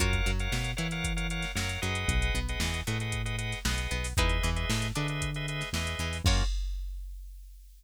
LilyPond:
<<
  \new Staff \with { instrumentName = "Pizzicato Strings" } { \time 4/4 \key fis \mixolydian \tempo 4 = 115 <eis' fis' ais' cis''>8 fis8 b8 e'4. fis8 fis8 | r8 b8 e8 a4. b8 b8 | <dis' e' gis' b'>8 e8 a8 d'4. e8 e8 | <eis' fis' ais' cis''>4 r2. | }
  \new Staff \with { instrumentName = "Drawbar Organ" } { \time 4/4 \key fis \mixolydian <ais' cis'' eis'' fis''>8. <ais' cis'' eis'' fis''>8. <ais' cis'' eis'' fis''>16 <ais' cis'' eis'' fis''>8 <ais' cis'' eis'' fis''>16 <ais' cis'' eis'' fis''>8 <ais' cis'' eis'' fis''>8 <gis' b' dis'' fis''>8~ | <gis' b' dis'' fis''>8. <gis' b' dis'' fis''>8. <gis' b' dis'' fis''>16 <gis' b' dis'' fis''>8 <gis' b' dis'' fis''>16 <gis' b' dis'' fis''>8 <gis' b' dis'' fis''>4 | <gis' b' dis'' e''>8. <gis' b' dis'' e''>8. <gis' b' dis'' e''>16 <gis' b' dis'' e''>8 <gis' b' dis'' e''>16 <gis' b' dis'' e''>8 <gis' b' dis'' e''>4 | <ais cis' eis' fis'>4 r2. | }
  \new Staff \with { instrumentName = "Synth Bass 1" } { \clef bass \time 4/4 \key fis \mixolydian fis,8 fis,8 b,8 e4. fis,8 fis,8 | b,,8 b,,8 e,8 a,4. b,,8 b,,8 | e,8 e,8 a,8 d4. e,8 e,8 | fis,4 r2. | }
  \new DrumStaff \with { instrumentName = "Drums" } \drummode { \time 4/4 <hh bd>16 <hh bd>16 hh16 hh16 sn16 hh16 hh16 <hh sn>16 <hh bd>16 hh16 hh16 <hh sn>16 sn16 hh16 hh16 hh16 | <hh bd>16 hh16 hh16 hh16 sn16 <hh sn>16 hh16 hh16 <hh bd>16 hh16 hh16 <hh sn>16 sn16 hh16 hh16 <hho sn>16 | <hh bd>16 hh16 hh16 hh16 sn16 <hh sn>16 hh16 hh16 <hh bd>16 hh16 hh16 <hh sn>16 sn16 hh16 hh16 hho16 | <cymc bd>4 r4 r4 r4 | }
>>